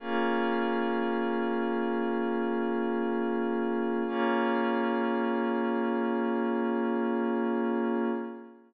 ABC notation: X:1
M:4/4
L:1/8
Q:1/4=118
K:Bbm
V:1 name="Pad 5 (bowed)"
[B,DFA]8- | [B,DFA]8 | [B,DFA]8- | [B,DFA]8 |]